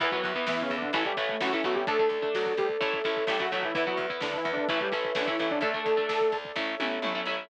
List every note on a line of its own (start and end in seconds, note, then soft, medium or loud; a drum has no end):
0.00 0.19 E2 medium
0.00 0.09 E3 medium
0.00 0.11 E3 medium
0.00 0.09 B3 medium
0.00 0.11 E4 medium
0.00 0.93 B4 medium
0.00 0.11 B4 medium
0.00 0.93 E5 medium
0.00 kick medium
0.00 crash medium
0.11 0.31 E3 medium
0.11 0.32 F#3 medium
0.11 0.31 B3 medium
0.11 0.32 F#4 medium
0.11 0.22 B4 medium
0.11 kick medium
0.24 0.45 E2 medium
0.24 kick medium
0.24 closed hi-hat medium
0.35 0.73 E3 medium
0.35 0.73 B3 medium
0.35 kick medium
0.46 0.66 E2 medium
0.46 0.63 E3 medium
0.46 0.84 B3 medium
0.46 0.63 E4 medium
0.46 kick medium
0.46 snare medium
0.58 0.76 C#3 medium
0.58 0.76 C#4 medium
0.58 kick medium
0.70 0.91 E2 medium
0.70 kick medium
0.70 closed hi-hat soft
0.77 0.92 D3 medium
0.77 0.92 D4 medium
0.82 kick medium
0.93 1.13 A1 loud
0.93 1.04 E3 medium
0.93 1.13 E3 medium
0.93 1.13 A3 medium
0.93 1.13 C#4 medium
0.93 1.04 E4 medium
0.93 1.87 A4 medium
0.93 1.87 C#5 medium
0.93 1.87 E5 medium
0.93 kick medium
0.93 closed hi-hat medium
1.05 1.16 G3 medium
1.05 1.16 G4 medium
1.05 kick medium
1.17 1.37 A1 medium
1.17 1.36 E3 medium
1.17 1.36 A3 medium
1.17 1.36 C#4 medium
1.17 kick medium
1.17 closed hi-hat medium
1.29 1.42 A3 medium
1.29 kick medium
1.41 1.61 A1 medium
1.41 1.50 E3 medium
1.41 1.52 F#3 medium
1.41 1.50 A3 medium
1.41 1.50 C#4 medium
1.41 1.63 C#4 medium
1.41 1.52 F#4 medium
1.41 kick medium
1.41 snare medium
1.53 1.62 E3 medium
1.53 1.64 E3 medium
1.53 1.62 A3 medium
1.53 1.62 C#4 medium
1.53 1.64 E4 medium
1.53 kick medium
1.63 1.84 A1 medium
1.63 1.83 E3 medium
1.63 1.76 F#3 medium
1.63 1.83 A3 medium
1.63 1.83 B3 medium
1.63 1.83 C#4 medium
1.63 1.76 F#4 medium
1.63 kick medium
1.63 closed hi-hat medium
1.75 1.86 G3 medium
1.75 1.86 G4 medium
1.75 kick medium
1.87 2.08 D2 loud
1.87 2.09 A3 medium
1.87 1.97 A3 medium
1.87 1.97 D4 medium
1.87 2.09 A4 medium
1.87 2.80 A4 medium
1.87 3.46 A4 medium
1.87 2.80 D5 medium
1.87 kick medium
1.87 closed hi-hat medium
1.99 2.18 A3 medium
1.99 2.18 D4 medium
1.99 kick medium
2.09 2.29 D2 medium
2.09 kick medium
2.09 closed hi-hat medium
2.22 2.60 A3 medium
2.22 2.60 D4 medium
2.22 kick medium
2.34 2.55 D2 medium
2.34 2.53 F#3 medium
2.34 2.53 F#4 medium
2.34 kick medium
2.34 snare medium
2.46 kick medium
2.57 2.77 D2 medium
2.57 2.69 G3 medium
2.57 2.69 G4 medium
2.57 kick medium
2.57 closed hi-hat medium
2.69 kick medium
2.81 3.02 A1 medium
2.81 2.99 A3 medium
2.81 2.99 C#4 medium
2.81 2.99 E4 medium
2.81 3.74 A4 medium
2.81 3.74 C#5 medium
2.81 3.74 E5 medium
2.81 kick medium
2.81 closed hi-hat medium
2.93 kick medium
3.04 3.25 A1 medium
3.04 3.24 A3 medium
3.04 3.24 C#4 medium
3.04 3.24 E4 medium
3.04 kick medium
3.04 closed hi-hat medium
3.17 kick medium
3.27 3.47 A1 medium
3.27 3.39 G3 medium
3.27 3.38 A3 medium
3.27 3.38 C#4 medium
3.27 3.38 E4 medium
3.27 3.39 G4 medium
3.27 kick medium
3.27 snare medium
3.40 3.52 F#3 medium
3.40 3.49 A3 medium
3.40 3.49 C#4 medium
3.40 3.49 E4 medium
3.40 3.52 F#4 medium
3.40 kick medium
3.52 3.72 A1 medium
3.52 3.64 F#3 medium
3.52 3.71 A3 medium
3.52 3.71 C#4 medium
3.52 3.71 E4 medium
3.52 3.64 F#4 medium
3.52 kick medium
3.52 closed hi-hat medium
3.63 3.74 E3 medium
3.63 3.74 E4 medium
3.63 kick medium
3.74 3.97 E2 medium
3.74 3.85 E3 medium
3.74 3.84 B3 medium
3.74 3.85 E4 medium
3.74 3.84 E4 medium
3.74 5.29 B4 medium
3.74 4.68 B4 medium
3.74 4.68 E5 medium
3.74 kick medium
3.74 closed hi-hat medium
3.86 4.06 F#3 medium
3.86 4.05 B3 medium
3.86 4.05 E4 medium
3.86 4.06 F#4 medium
3.86 kick medium
3.97 4.17 E2 medium
3.97 kick medium
3.97 closed hi-hat medium
4.10 4.48 B3 medium
4.10 4.48 E4 medium
4.10 kick medium
4.21 4.40 E2 medium
4.21 4.37 D3 medium
4.21 4.37 D4 medium
4.21 kick medium
4.21 snare medium
4.33 4.52 E3 medium
4.33 4.52 E4 medium
4.33 kick medium
4.45 4.65 E2 medium
4.45 kick medium
4.45 closed hi-hat medium
4.53 4.67 D3 medium
4.53 4.67 D4 medium
4.57 kick medium
4.68 4.89 A1 medium
4.68 4.79 E3 medium
4.68 4.88 A3 medium
4.68 4.88 C#4 medium
4.68 4.79 E4 medium
4.68 4.88 E4 medium
4.68 5.62 A4 medium
4.68 5.62 C#5 medium
4.68 5.62 E5 medium
4.68 kick medium
4.68 closed hi-hat medium
4.81 4.92 G3 medium
4.81 4.92 G4 medium
4.81 kick medium
4.92 5.13 A1 medium
4.92 5.11 A3 medium
4.92 5.11 C#4 medium
4.92 5.11 E4 medium
4.92 kick medium
4.92 closed hi-hat medium
5.05 kick medium
5.15 5.36 A1 medium
5.15 5.27 D3 medium
5.15 5.25 A3 medium
5.15 5.25 C#4 medium
5.15 5.27 D4 medium
5.15 5.25 E4 medium
5.15 kick medium
5.15 snare medium
5.27 5.39 E3 medium
5.27 5.37 A3 medium
5.27 5.37 C#4 medium
5.27 5.37 E4 medium
5.27 5.39 E4 medium
5.27 kick medium
5.39 5.59 A1 medium
5.39 5.51 E3 medium
5.39 5.58 A3 medium
5.39 5.58 C#4 medium
5.39 5.51 E4 medium
5.39 5.58 E4 medium
5.39 kick medium
5.39 closed hi-hat medium
5.50 5.62 D3 medium
5.50 5.62 D4 medium
5.50 kick medium
5.61 5.81 D2 medium
5.61 6.37 A3 medium
5.61 5.72 A3 medium
5.61 5.72 D4 medium
5.61 6.37 A4 medium
5.61 6.55 A4 medium
5.61 6.29 A4 medium
5.61 6.55 D5 medium
5.61 kick medium
5.61 closed hi-hat medium
5.74 5.93 A3 medium
5.74 5.93 D4 medium
5.74 kick medium
5.86 6.06 D2 medium
5.86 kick medium
5.86 closed hi-hat medium
5.97 6.35 A3 medium
5.97 6.35 D4 medium
5.97 kick medium
6.09 6.29 D2 medium
6.09 kick medium
6.09 snare loud
6.21 kick medium
6.32 6.52 D2 medium
6.32 kick medium
6.32 closed hi-hat medium
6.45 kick medium
6.56 6.75 A1 medium
6.56 6.75 A3 medium
6.56 6.75 C#4 medium
6.56 6.75 E4 medium
6.56 7.49 A4 medium
6.56 7.49 C#5 medium
6.56 7.49 E5 loud
6.56 kick medium
6.56 snare medium
6.80 7.00 A1 medium
6.80 6.99 A3 medium
6.80 6.99 C#4 medium
6.80 6.99 E4 medium
6.80 high tom medium
7.02 7.22 A1 medium
7.02 7.13 A3 medium
7.02 7.13 C#4 medium
7.02 7.13 E4 medium
7.02 mid tom medium
7.15 7.24 A3 medium
7.15 7.24 C#4 medium
7.15 7.24 E4 medium
7.25 7.45 A1 medium
7.25 7.45 A3 medium
7.25 7.45 C#4 medium
7.25 7.45 E4 medium